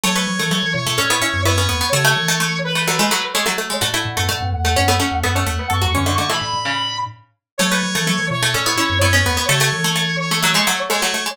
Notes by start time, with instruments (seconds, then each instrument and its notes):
0.03 glockenspiel F#3, pizzicato strings A3 C#5, brass section C#5
0.15 pizzicato strings A3 B4
0.27 glockenspiel F#3
0.39 glockenspiel E3, pizzicato strings A3
0.51 glockenspiel F#3, pizzicato strings A3
0.63 glockenspiel E3
0.74 glockenspiel B2, brass section C#5
0.86 glockenspiel B2, pizzicato strings A3
0.98 glockenspiel A2, pizzicato strings C#4 A4
1.10 pizzicato strings B3 E4
1.21 pizzicato strings C#4 E4
1.34 glockenspiel F#2
1.45 glockenspiel F#2, pizzicato strings B3 E4, brass section C#5
1.58 pizzicato strings B3 C#4
1.69 glockenspiel E2, pizzicato strings B3
1.81 pizzicato strings B3
1.92 glockenspiel C#3, pizzicato strings A3 A4, brass section C#5
2.04 pizzicato strings A3
2.16 glockenspiel E3
2.28 pizzicato strings A3
2.40 pizzicato strings A3
2.64 brass section B4
2.75 pizzicato strings A3
2.87 pizzicato strings F#3 A3
2.99 pizzicato strings G#3 A3
3.11 pizzicato strings F#3 A3
3.34 pizzicato strings G#3 A3, brass section C#5
3.46 pizzicato strings F#3 A3
3.58 pizzicato strings A3
3.70 pizzicato strings G#3
3.81 glockenspiel A2, pizzicato strings A3 F#4, brass section F#5
3.94 pizzicato strings A3 E4
4.05 glockenspiel A2
4.17 glockenspiel F#2, pizzicato strings A3
4.29 glockenspiel A2, pizzicato strings A3
4.41 glockenspiel F#2
4.53 glockenspiel E2, brass section F#5
4.64 glockenspiel E2, pizzicato strings A3
4.76 glockenspiel F#2, pizzicato strings C#4
4.88 pizzicato strings A3 B3
5.00 pizzicato strings A3 C#4
5.12 glockenspiel E2
5.23 glockenspiel F#2, pizzicato strings A3 B3, brass section F#5
5.35 pizzicato strings A3 C#4
5.46 glockenspiel E2, pizzicato strings A3
5.59 pizzicato strings B3
5.70 glockenspiel F#2, pizzicato strings A3 A4, brass section C#6
5.81 glockenspiel E2, pizzicato strings F#3 F#4, brass section C#6
5.94 glockenspiel F#2, pizzicato strings D3 C#4, brass section C#6
6.06 pizzicato strings D3 A3
6.18 pizzicato strings D3 A3, brass section C#6
6.29 pizzicato strings E3 A3, brass section B5
6.40 glockenspiel A2, brass section B5
6.53 glockenspiel A2
6.65 pizzicato strings C#3
7.58 glockenspiel F#3, pizzicato strings A3 C#5, brass section C#5
7.71 pizzicato strings A3 B4
7.83 glockenspiel F#3
7.95 glockenspiel E3, pizzicato strings A3
8.07 glockenspiel F#3, pizzicato strings A3
8.19 glockenspiel E3
8.30 glockenspiel B2, brass section C#5
8.42 glockenspiel B2, pizzicato strings A3
8.54 glockenspiel A2, pizzicato strings C#4 A4
8.66 pizzicato strings B3 E4
8.77 pizzicato strings C#4 E4
8.90 glockenspiel F#2
9.01 glockenspiel F#2, pizzicato strings B3 E4, brass section C#5
9.13 pizzicato strings B3 C#4
9.25 glockenspiel E2, pizzicato strings B3
9.37 pizzicato strings B3
9.49 glockenspiel C#3, pizzicato strings A3, brass section C#5
9.60 pizzicato strings A3
9.72 glockenspiel E3
9.84 pizzicato strings A3
9.95 pizzicato strings A3
10.19 brass section C#5
10.31 pizzicato strings A3
10.43 pizzicato strings F#3 A3
10.54 pizzicato strings G#3 A3
10.67 pizzicato strings F#3 A3
10.90 pizzicato strings G#3 A3, brass section C#5
11.02 pizzicato strings F#3 A3
11.14 pizzicato strings A3
11.26 pizzicato strings G#3